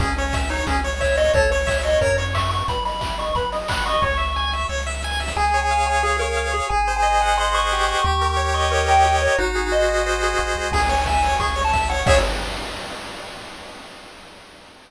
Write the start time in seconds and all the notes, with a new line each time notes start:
0.00 C#2 C#4 G#4, kick, closed hi-hat
0.17 C#4 C#5, open hi-hat
0.33 E5, kick, snare
0.49 D#4 C#5, open hi-hat
0.67 C#2 C#4 G#4, kick, closed hi-hat
0.84 C#5, open hi-hat
1.00 C#5 E5, kick, clap
1.17 C#5 D#5, open hi-hat
1.33 C#2 A4 C#5, kick, closed hi-hat
1.51 C#5, open hi-hat
1.67 E5, kick, clap
1.83 C#5 D#5, open hi-hat
2.01 F#2 A#4 C#5, kick, closed hi-hat
2.18 C#5, open hi-hat
2.34 E5 C#6, kick, clap
2.51 F#5 C#6, open hi-hat
2.68 B1 B4 B5, kick, closed hi-hat
2.85 D#5 B5, open hi-hat
3.00 E5, kick, clap
3.18 D#5 C#6, open hi-hat
3.35 B1 B4 B5, kick, closed hi-hat
3.52 D#5, open hi-hat
3.68 F#5 B5, kick, clap
3.86 D#5 C#6, open hi-hat
4.02 C#2 C#5 C#6, kick, snare
4.17 E5, snare
4.36 G#5, snare
4.52 E5, snare
4.69 C#2 C#5, snare
4.78 snare
4.86 E5, snare
4.94 snare
5.03 G#5, snare
5.11 snare
5.19 E5, snare
5.28 snare
5.36 C#2 G#4 G#5
5.54 C#5
5.61 G#5
5.71 F5
5.87 C#5 G#5
6.03 G#4
6.19 A#4 C#5
6.37 F5
6.52 G#4 C#5
6.69 G#1 G#4 G#5
6.88 C5
6.96 G#5
7.02 D#5
7.21 F#5 G#5
7.38 D#5 C6
7.54 C5 C#6
7.72 G4
7.87 C5 C#6
8.04 D#2 G4 C#6
8.21 A#4
8.30 C#6
8.37 C#5
8.54 D#5 C#6
8.72 A#4 C#5
8.88 A#4 G5
9.04 G4
9.22 A#4 C#5
9.38 G#1 D#4 F#4
9.55 G#4
9.72 C5 D#5
9.89 D#5
10.06 C5
10.23 G#4
10.38 A1 F#4
10.56 C2 G#4
10.72 C#2 G#4 G#5, kick, crash
10.89 C#5, open hi-hat
11.06 E5 G#5, kick, snare
11.23 C#5, open hi-hat
11.40 C#2 G#4 C#6, kick, closed hi-hat
11.56 C#5, open hi-hat
11.64 A5
11.73 E5, kick, snare
11.89 C#5 F#5, open hi-hat
12.06 C#2 G#4 C#5 E5, kick, crash